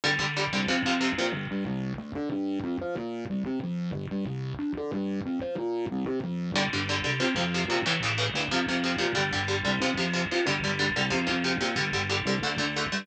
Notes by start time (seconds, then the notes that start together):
0.04 G1 D3 G3
0.19 G1 D3 G3
0.37 D3 G3
0.53 C2 D3 G3
0.68 F2 C3 F3
0.85 F2 C3 F3
1.01 C3 F3
1.18 A#2 C3 F3
1.33 G1
1.51 G2
1.66 C2
1.98 D2
2.15 D3
2.32 G2
2.64 F2
2.81 F3
2.97 A#2
3.30 C2
3.46 C3
3.63 F2
3.93 G1
4.11 G2
4.26 C2
4.59 D2
4.77 D3
4.93 G2
5.26 F2
5.41 F3
5.58 A#2
5.91 C2
6.06 C3
6.24 F2
6.54 G1 D3 G3
6.73 G1 D3 G3
6.89 D3 G3
7.04 C2 D3 G3
7.20 F2 C3 F3
7.36 F2 C3 F3
7.54 C3 F3
7.68 A#2 C3 F3
7.86 A1 A2 C#3 E3
8.02 A1 A2 C#3 E3
8.18 A2 C#3 E3
8.34 D2 A2 C#3 E3
8.51 F2 C3 F3
8.68 F2 C3 F3
8.84 C3 F3
8.98 A#2 C3 F3
9.15 G1 D3 G3
9.33 G1 D3 G3
9.48 D3 G3
9.65 C2 D3 G3
9.80 F2 C3 F3
9.97 F2 C3 F3
10.13 C3 F3
10.31 A#2 C3 F3
10.46 G1 D3 G3
10.63 G1 D3 G3
10.79 D3 G3
10.96 C2 D3 G3
11.10 F2 C3 F3
11.27 F2 C3 F3
11.44 C3 F3
11.61 A#2 C3 F3
11.76 G1 D3 G3
11.93 G1 D3 G3
12.10 D3 G3
12.25 C2 D3 G3
12.42 D2 D3 A3
12.58 D2 D3 A3
12.76 D3 A3
12.92 G2 D3 A3